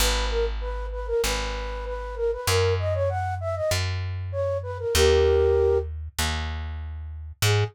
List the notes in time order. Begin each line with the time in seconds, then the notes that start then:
0.00 G#1 B4
0.31 A#4
0.61 B4
0.92 B4
1.07 A#4
1.24 G#1 B4
1.86 B4
2.16 A#4
2.32 B4
2.47 F#2 A#4
2.79 D#5
2.94 C#5
3.09 F#5
3.41 E5
3.56 D#5
3.71 F#2
4.32 C#5
4.63 B4
4.79 A#4
4.95 D#2 G4 A#4
6.19 D#2
7.42 G#2 G#4